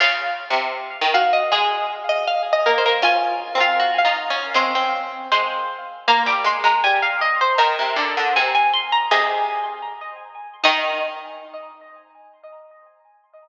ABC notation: X:1
M:2/4
L:1/16
Q:1/4=79
K:Db
V:1 name="Harpsichord"
f6 f e | A6 B B | a3 f2 f z2 | c'4 c4 |
[K:Eb] b d' c' b a f e c | b4 a a c' b | e4 z4 | e8 |]
V:2 name="Harpsichord"
F6 G2 | e3 e (3f2 e2 c2 | F3 F (3G2 F2 D2 | C C5 z2 |
[K:Eb] B,8 | B8 | A4 z4 | E8 |]
V:3 name="Harpsichord"
(3D,4 C,4 E,4 | A,6 B, B, | (3D4 C4 E4 | A,4 A,2 z2 |
[K:Eb] B, G, A, A, G,4 | E, C, D, D, C,4 | C,4 z4 | E,8 |]